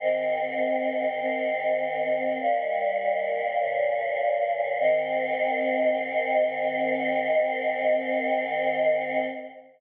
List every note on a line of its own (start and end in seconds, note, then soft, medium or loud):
0.00 1.19 G#2 medium
0.00 1.19 D#3 medium
0.00 1.19 C4 medium
1.20 2.39 G#2 medium
1.20 2.39 D#3 medium
1.20 2.39 C4 medium
2.40 3.59 D#2 medium
2.40 3.59 A#2 medium
2.40 3.59 G3 medium
3.60 4.79 G2 medium
3.60 4.79 A#2 medium
3.60 4.79 C#3 medium
4.80 9.24 G#2 loud
4.80 9.24 D#3 loud
4.80 9.24 C4 loud